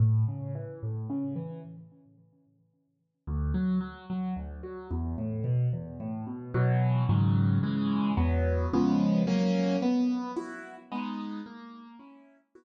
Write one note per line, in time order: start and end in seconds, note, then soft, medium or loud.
0.00 0.24 A2 loud
0.28 0.52 C#3 medium
0.55 0.80 E3 medium
0.83 1.07 A2 medium
1.10 1.34 C#3 medium
1.36 1.60 E3 medium
3.27 3.52 D2 loud
3.54 3.79 F#3 medium
3.81 4.05 F#3 medium
4.10 4.34 F#3 medium
4.36 4.61 D2 medium
4.63 4.88 F#3 medium
4.91 5.15 E2 medium
5.18 5.43 A2 medium
5.44 5.69 B2 medium
5.73 5.97 E2 medium
6.00 6.25 A2 medium
6.27 6.51 B2 medium
6.54 7.03 B2 loud
6.54 7.03 E3 loud
6.54 7.03 F#3 loud
7.09 7.58 G#2 loud
7.09 7.58 C#3 loud
7.09 7.58 D#3 loud
7.09 7.58 F#3 loud
7.63 8.12 C#3 loud
7.63 8.12 E3 loud
7.63 8.12 G#3 loud
8.17 8.66 E2 loud
8.17 8.66 F#3 loud
8.17 8.66 B3 loud
8.73 9.23 C#3 loud
8.73 9.23 F3 loud
8.73 9.23 G#3 loud
8.73 9.23 B3 loud
9.27 9.76 F#3 loud
9.27 9.76 A#3 loud
9.27 9.76 C#4 loud
9.82 10.31 B3 loud
10.36 10.75 E4 medium
10.36 10.75 F#4 medium
10.92 11.41 G#3 loud
10.92 11.41 B3 loud
10.92 11.41 D#4 loud
11.46 11.95 A#3 loud
11.99 12.38 C#4 medium
11.99 12.38 E4 medium
12.55 12.64 B3 loud
12.55 12.64 E4 loud
12.55 12.64 F#4 loud